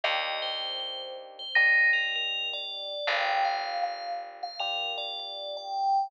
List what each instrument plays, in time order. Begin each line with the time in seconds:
0.04 electric bass (finger) D#2, electric piano 1 A#3 D4 D#4 G4, tubular bells D#5
0.42 tubular bells C5
0.80 tubular bells C5
1.39 tubular bells C5
1.55 electric piano 1 A#3 D4 D#4 G4, tubular bells D#4
1.93 tubular bells A#4
2.16 tubular bells A#4
2.53 tubular bells D5
3.07 electric bass (finger) G1, electric piano 1 A#3 D4 F4 G4, tubular bells G5
3.45 tubular bells F5
3.83 tubular bells F5
4.43 tubular bells F5
4.59 electric piano 1 A#3 D4 F4 G4, tubular bells A#4
4.98 tubular bells D5
5.19 tubular bells D5
5.57 tubular bells G5